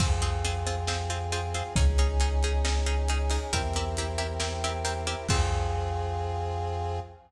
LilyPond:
<<
  \new Staff \with { instrumentName = "Pizzicato Strings" } { \time 4/4 \key f \minor \tempo 4 = 136 <c' f' aes'>8 <c' f' aes'>8 <c' f' aes'>8 <c' f' aes'>8 <c' f' aes'>8 <c' f' aes'>8 <c' f' aes'>8 <c' f' aes'>8 | <des' ees' aes'>8 <des' ees' aes'>8 <des' ees' aes'>8 <des' ees' aes'>8 <des' ees' aes'>8 <des' ees' aes'>8 <des' ees' aes'>8 <des' ees' aes'>8 | <c' e' g' bes'>8 <c' e' g' bes'>8 <c' e' g' bes'>8 <c' e' g' bes'>8 <c' e' g' bes'>8 <c' e' g' bes'>8 <c' e' g' bes'>8 <c' e' g' bes'>8 | <c' f' aes'>1 | }
  \new Staff \with { instrumentName = "Synth Bass 2" } { \clef bass \time 4/4 \key f \minor f,1 | des,1 | e,1 | f,1 | }
  \new Staff \with { instrumentName = "Brass Section" } { \time 4/4 \key f \minor <c' f' aes'>1 | <des' ees' aes'>1 | <c' e' g' bes'>1 | <c' f' aes'>1 | }
  \new DrumStaff \with { instrumentName = "Drums" } \drummode { \time 4/4 <cymc bd>8 hh8 hh8 hh8 sn8 hh8 hh8 hh8 | <hh bd>8 hh8 hh8 hh8 sn8 hh8 hh8 hho8 | <hh bd>8 hh8 hh8 hh8 sn8 hh8 hh8 hh8 | <cymc bd>4 r4 r4 r4 | }
>>